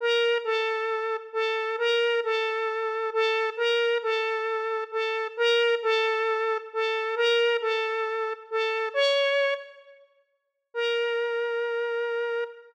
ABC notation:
X:1
M:4/4
L:1/8
Q:1/4=134
K:Bb
V:1 name="Lead 1 (square)"
B2 A4 A2 | B2 A4 A2 | B2 A4 A2 | B2 A4 A2 |
B2 A4 A2 | _d3 z5 | B8 |]